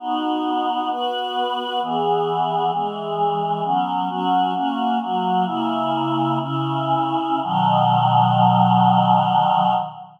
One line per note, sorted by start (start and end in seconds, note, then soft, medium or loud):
0.00 0.89 B3 medium
0.00 0.90 D#4 medium
0.00 0.89 F#4 medium
0.90 1.80 B3 medium
0.90 1.80 F#4 medium
0.90 1.80 B4 medium
1.81 2.71 E3 medium
1.81 2.71 B3 medium
1.81 2.71 G#4 medium
2.73 3.63 E3 medium
2.73 3.63 G#3 medium
2.73 3.63 G#4 medium
3.64 4.08 F#3 medium
3.64 4.09 B3 medium
3.64 4.08 C#4 medium
4.09 4.54 F#3 medium
4.09 4.53 C#4 medium
4.09 4.53 F#4 medium
4.54 4.99 A#3 medium
4.54 4.99 C#4 medium
4.54 4.99 F#4 medium
5.01 5.46 F#3 medium
5.01 5.45 A#3 medium
5.01 5.46 F#4 medium
5.45 6.39 C#3 medium
5.45 6.39 A#3 medium
5.45 6.39 E4 medium
6.39 7.41 C#3 medium
6.39 7.41 C#4 medium
6.39 7.41 E4 medium
7.43 9.74 B2 medium
7.43 9.74 D#3 loud
7.43 9.74 F#3 loud